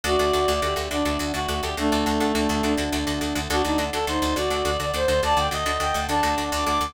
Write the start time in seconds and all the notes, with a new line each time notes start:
0.03 D2 A3 D4 F#4 A4 D5
0.19 D2 D4 F#4 A4
0.33 D2 D4 F#4 A4
0.48 D2 D4 F#4 A4
0.62 D2 D4 F#4 G4 A4
0.76 D2 D4 F#4 A4
0.91 D2 D4 F#4 A4 D5
1.05 D2 D4 F#4 A4
1.19 D2 D4 F#4 A4
1.34 D2 D4 F#4 A4
1.48 D2 D4 F#4 A4
1.62 D2 D4 F#4 G4 A4
1.77 D2 A3 D4 F#4 A4
1.92 D2 D4 F#4 A4
2.06 D2 D4 F#4 A4
2.20 D2 D4 F#4 A4
2.35 D2 D4 F#4 A4
2.49 D2 D4 F#4 A4
2.63 D2 D4 F#4 A4
2.77 D2 D4 F#4 A4
2.92 D2 D4 F#4 A4
3.07 D2 D4 F#4 A4
3.21 D2 D4 F#4 A4
3.35 D2 D4 F#4 A4
3.50 D2 D4 F#4 A4 D5 F#5
3.64 D2 D4 D#4 F#4 A4
3.78 D2 D4 F#4 A4
3.93 D2 D4 F#4 A4
4.07 D2 D4 D#4 F#4 A4 C5
4.22 D2 D4 F#4 A4
4.36 D2 D4 F#4 A4 D5
4.50 D2 D4 F#4 A4
4.65 D2 D4 F#4 A4
4.79 D2 D4 F#4 A4 D5
4.94 D2 D4 F#4 A4 C5
5.08 D2 D4 F#4 A4 C5
5.23 D2 D4 F#4 A4 D5 F#5 A5
5.37 D2 D4 F#4 A4 G5
5.51 D2 D4 F#4 A4 D#5
5.66 D2 D4 F#4 A4
5.80 D2 D4 F#4 A4 G5
5.94 D2 D4 F#4 A4
6.08 D2 D4 F#4 A4 A5
6.23 D2 D4 F#4 A4
6.38 D2 D4 F#4 A4
6.52 D2 D4 F#4 A4 D6
6.66 D2 D4 F#4 A4 D6
6.81 D2 D4 F#4 A4